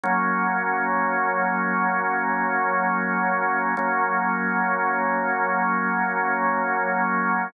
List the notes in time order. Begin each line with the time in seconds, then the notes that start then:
0.04 F#3 A#3 C#4
3.77 F#3 A#3 C#4